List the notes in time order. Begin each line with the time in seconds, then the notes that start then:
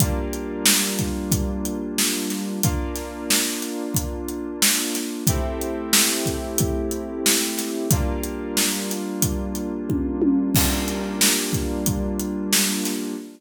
0.00 G3 A#3 D4 F4, kick, closed hi-hat
0.33 closed hi-hat
0.66 snare
0.99 kick, closed hi-hat
1.32 kick, closed hi-hat
1.65 closed hi-hat
1.98 snare
2.30 snare, closed hi-hat
2.63 A#3 D4 F4, kick, closed hi-hat
2.96 snare, closed hi-hat
3.30 snare
3.62 snare, closed hi-hat
3.95 kick, closed hi-hat
4.28 closed hi-hat
4.62 snare
4.95 snare, closed hi-hat
5.27 A3 C4 E4 G4, kick, closed hi-hat
5.61 closed hi-hat
5.93 snare
6.26 kick, closed hi-hat
6.58 kick, closed hi-hat
6.91 closed hi-hat
7.26 snare
7.58 snare, closed hi-hat
7.91 G3 A#3 D4 F4, kick, closed hi-hat
8.23 closed hi-hat
8.57 snare
8.89 snare, closed hi-hat
9.22 kick, closed hi-hat
9.55 closed hi-hat
9.89 kick, high tom
10.22 high tom
10.55 G3 A#3 D4 F4, kick, crash
10.88 closed hi-hat
11.21 snare
11.53 kick, closed hi-hat
11.86 kick, closed hi-hat
12.20 closed hi-hat
12.53 snare
12.85 snare, closed hi-hat